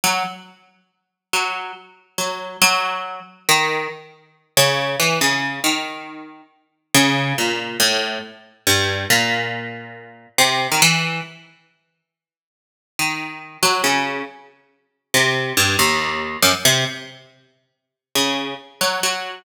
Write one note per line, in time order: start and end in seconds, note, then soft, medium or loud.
0.04 0.23 F#3 medium
1.33 1.72 F#3 medium
2.18 2.57 F#3 medium
2.62 3.20 F#3 loud
3.49 3.88 D#3 medium
4.57 4.96 C#3 loud
5.00 5.19 E3 medium
5.21 5.60 C#3 medium
5.64 6.42 D#3 medium
6.94 7.33 C#3 loud
7.38 7.77 A#2 medium
7.80 8.19 A2 medium
8.67 9.06 G2 medium
9.10 10.27 A#2 medium
10.38 10.67 C3 medium
10.72 10.81 D#3 medium
10.82 11.21 E3 loud
12.99 13.57 D#3 medium
13.63 13.82 F#3 medium
13.84 14.23 C#3 medium
15.14 15.53 C3 medium
15.57 15.76 G2 medium
15.79 16.37 D#2 medium
16.42 16.52 F#2 medium
16.65 16.85 C3 loud
18.15 18.54 C#3 medium
18.81 19.00 F#3 medium
19.03 19.42 F#3 medium